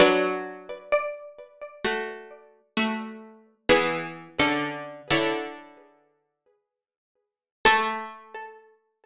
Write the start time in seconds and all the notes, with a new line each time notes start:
0.00 F#3 D4 B4 D5
0.92 D5
1.84 A3 F#4
2.77 A3 F#4
3.69 E3 B3 G#4 B4
4.39 D3 C#4 A4
5.10 D3 E4 C#5
7.65 A3 A4